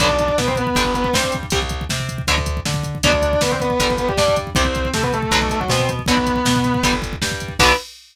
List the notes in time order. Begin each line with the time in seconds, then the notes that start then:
0.00 B1 D3 F#3 B3 D4 D5, kick, closed hi-hat
0.09 kick
0.19 kick, closed hi-hat
0.28 kick
0.38 B2 B3 B4, kick, snare
0.47 C4 C5, kick
0.56 B3 B4, kick, closed hi-hat
0.67 kick
0.75 G1 D3 G3, kick, closed hi-hat
0.84 kick
0.94 B3 B4, kick, closed hi-hat
1.04 B3 B4, kick
1.13 G2 G3 C4 C5, kick, snare
1.24 kick
1.32 kick, closed hi-hat
1.43 kick
1.50 C2 C3 G3, kick, closed hi-hat
1.62 kick
1.69 kick, closed hi-hat
1.81 kick
1.89 C3 C4, kick, snare
2.00 kick
2.09 kick, closed hi-hat
2.18 kick
2.27 D2 B2 D3 F#3, kick, closed hi-hat
2.38 kick
2.46 kick, closed hi-hat
2.57 kick
2.65 D3 D4, kick, snare
2.74 kick
2.83 kick, closed hi-hat
2.95 kick
3.03 D2 B2 D3 F#3 D4 D5, kick, closed hi-hat
3.12 kick
3.22 kick, closed hi-hat
3.33 kick
3.41 D3 B3 D4 B4, kick, snare
3.51 C4 C5, kick
3.60 B3 B4, kick, closed hi-hat
3.70 kick
3.80 G1 D3 G3, kick, closed hi-hat
3.90 kick
3.98 B3 B4, kick, closed hi-hat
4.08 G3 G4, kick
4.17 G2 G3 D4 D5, kick, snare
4.28 kick
4.36 kick, closed hi-hat
4.47 kick
4.55 C2 C3 G3 C4 C5, kick, closed hi-hat
4.65 kick
4.75 kick, closed hi-hat
4.85 kick
4.94 C3 A3 C4 A4, kick, snare
5.03 B3 B4, kick
5.13 A3 A4, kick, closed hi-hat
5.22 kick
5.31 B1 B2 D3 F#3, kick, closed hi-hat
5.42 kick
5.49 A3 A4, kick, closed hi-hat
5.60 F#3 F#4, kick
5.68 B2 B3 C4 C5, kick, snare
5.79 kick
5.89 kick, closed hi-hat
5.99 kick
6.06 B1 B2 D3 F#3 B3 B4, kick, closed hi-hat
6.17 kick
6.27 kick, closed hi-hat
6.36 kick
6.45 B2 B3, kick, snare
6.56 kick
6.64 kick, closed hi-hat
6.74 kick
6.83 G1 D3 G3, kick, closed hi-hat
6.93 kick
7.02 kick, closed hi-hat
7.13 kick
7.22 G2 G3, kick, snare
7.31 kick
7.40 kick, closed hi-hat
7.48 kick
7.59 B1 D3 F#3 B3 B4, kick, crash